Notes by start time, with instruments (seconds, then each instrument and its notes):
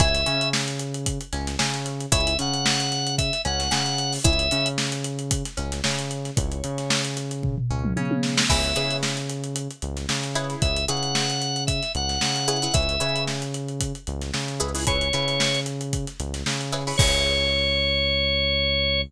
0.00 synth bass 1 C#2, pizzicato strings E4 G#4 C#5, drawbar organ E5, kick, closed hi-hat
0.14 snare, closed hi-hat
0.26 synth bass 1 C#3, pizzicato strings C#4, closed hi-hat
0.41 closed hi-hat
0.53 snare
0.68 closed hi-hat
0.79 closed hi-hat
0.94 closed hi-hat
1.06 kick, closed hi-hat
1.21 closed hi-hat
1.33 synth bass 1 C#2, pizzicato strings C#4, snare, closed hi-hat
1.47 snare, closed hi-hat
1.59 synth bass 1 C#3, pizzicato strings C#4, snare
1.74 closed hi-hat
1.86 snare, closed hi-hat
2.00 closed hi-hat
2.12 synth bass 1 C#2, pizzicato strings E4 G#4 C#5, drawbar organ E5, kick, closed hi-hat
2.27 closed hi-hat
2.39 synth bass 1 C#3, pizzicato strings C#4, drawbar organ F#5, closed hi-hat
2.54 closed hi-hat
2.66 snare
2.80 closed hi-hat
2.92 snare, closed hi-hat
3.07 closed hi-hat
3.18 drawbar organ E5, kick, closed hi-hat
3.33 snare, closed hi-hat
3.45 synth bass 1 C#2, pizzicato strings C#4, drawbar organ F#5, closed hi-hat
3.60 snare, closed hi-hat
3.71 synth bass 1 C#3, pizzicato strings C#4, snare
3.86 closed hi-hat
3.98 closed hi-hat
4.12 snare, open hi-hat
4.24 synth bass 1 C#2, pizzicato strings E4 G#4 C#5, drawbar organ E5, kick, closed hi-hat
4.39 closed hi-hat
4.51 synth bass 1 C#3, pizzicato strings C#4, closed hi-hat
4.66 closed hi-hat
4.78 snare
4.92 closed hi-hat
5.04 closed hi-hat
5.19 closed hi-hat
5.31 kick, closed hi-hat
5.45 snare, closed hi-hat
5.57 synth bass 1 C#2, pizzicato strings C#4, closed hi-hat
5.72 snare, closed hi-hat
5.84 synth bass 1 C#3, pizzicato strings C#4, snare
5.99 closed hi-hat
6.11 closed hi-hat
6.25 snare, closed hi-hat
6.36 synth bass 1 C#2, pizzicato strings E4 G#4 C#5, drawbar organ C#5, kick, closed hi-hat
6.52 closed hi-hat
6.64 synth bass 1 C#3, pizzicato strings C#4, closed hi-hat
6.78 snare, closed hi-hat
6.90 snare
7.05 closed hi-hat
7.17 snare, closed hi-hat
7.31 closed hi-hat
7.43 kick, floor tom
7.58 floor tom
7.71 synth bass 1 C#2, pizzicato strings C#4
7.85 mid tom
7.96 synth bass 1 C#3, pizzicato strings C#4, high tom
8.11 high tom
8.23 snare
8.37 snare
8.49 synth bass 1 C#2, pizzicato strings E4 G#4 B4 C#5, drawbar organ E5, kick, crash
8.64 closed hi-hat
8.76 synth bass 1 C#3, pizzicato strings E4 G#4 B4 C#5, closed hi-hat
8.91 closed hi-hat
9.03 snare
9.17 closed hi-hat
9.30 closed hi-hat
9.44 closed hi-hat
9.56 closed hi-hat
9.71 closed hi-hat
9.82 synth bass 1 C#2, closed hi-hat
9.97 snare, closed hi-hat
10.09 synth bass 1 C#3, snare
10.24 closed hi-hat
10.35 pizzicato strings E4 G#4 B4 C#5, closed hi-hat
10.50 snare, closed hi-hat
10.62 synth bass 1 C#2, drawbar organ E5, kick, closed hi-hat
10.76 closed hi-hat
10.88 synth bass 1 C#3, pizzicato strings E4 G#4 B4 C#5, drawbar organ F#5, closed hi-hat
11.03 closed hi-hat
11.15 snare
11.30 snare, closed hi-hat
11.42 closed hi-hat
11.56 closed hi-hat
11.67 drawbar organ E5, kick, closed hi-hat
11.83 snare, closed hi-hat
11.95 synth bass 1 C#2, drawbar organ F#5, closed hi-hat
12.09 snare, closed hi-hat
12.21 synth bass 1 C#3, snare
12.36 closed hi-hat
12.48 pizzicato strings E4 G#4 B4 C#5, closed hi-hat
12.62 pizzicato strings E4 G#4 B4 C#5, closed hi-hat
12.74 synth bass 1 C#2, pizzicato strings E4 G#4 B4 C#5, drawbar organ E5, kick, closed hi-hat
12.89 closed hi-hat
13.00 synth bass 1 C#3, pizzicato strings E4 G#4 B4 C#5, closed hi-hat
13.16 closed hi-hat
13.27 snare
13.42 closed hi-hat
13.54 closed hi-hat
13.68 closed hi-hat
13.81 kick, closed hi-hat
13.95 closed hi-hat
14.07 synth bass 1 C#2, closed hi-hat
14.21 snare, closed hi-hat
14.34 synth bass 1 C#3, snare
14.48 closed hi-hat
14.60 synth bass 1 C#2, pizzicato strings E4 G#4 B4 C#5, closed hi-hat
14.75 pizzicato strings E4 G#4 B4 C#5, open hi-hat
14.87 pizzicato strings E4 G#4 B4 C#5, drawbar organ C#5, kick, closed hi-hat
15.01 closed hi-hat
15.13 synth bass 1 C#3, pizzicato strings E4 G#4 B4 C#5, closed hi-hat
15.28 snare, closed hi-hat
15.40 snare
15.55 closed hi-hat
15.66 closed hi-hat
15.81 closed hi-hat
15.93 kick, closed hi-hat
16.07 snare, closed hi-hat
16.20 synth bass 1 C#2, closed hi-hat
16.34 snare, closed hi-hat
16.46 synth bass 1 C#3, snare
16.61 closed hi-hat
16.72 pizzicato strings E4 G#4 B4 C#5, snare, closed hi-hat
16.87 pizzicato strings E4 G#4 B4 C#5, open hi-hat
16.98 synth bass 1 C#2, pizzicato strings E4 G#4 B4 C#5, drawbar organ C#5, kick, crash